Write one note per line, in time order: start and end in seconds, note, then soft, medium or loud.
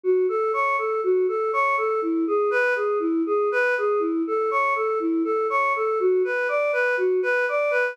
0.04 0.26 F#4 medium
0.29 0.52 A4 medium
0.53 0.76 C#5 medium
0.78 1.01 A4 medium
1.04 1.26 F#4 medium
1.28 1.51 A4 medium
1.53 1.76 C#5 medium
1.78 2.00 A4 medium
2.02 2.25 E4 medium
2.27 2.50 G#4 medium
2.51 2.74 B4 medium
2.76 2.99 G#4 medium
3.00 3.22 E4 medium
3.26 3.49 G#4 medium
3.52 3.75 B4 medium
3.78 4.01 G#4 medium
4.00 4.22 E4 medium
4.27 4.50 A4 medium
4.51 4.74 C#5 medium
4.76 4.99 A4 medium
5.00 5.23 E4 medium
5.24 5.47 A4 medium
5.50 5.73 C#5 medium
5.76 5.99 A4 medium
6.00 6.23 F#4 medium
6.25 6.47 B4 medium
6.49 6.71 D5 medium
6.73 6.95 B4 medium
6.97 7.20 F#4 medium
7.23 7.45 B4 medium
7.49 7.72 D5 medium
7.71 7.93 B4 medium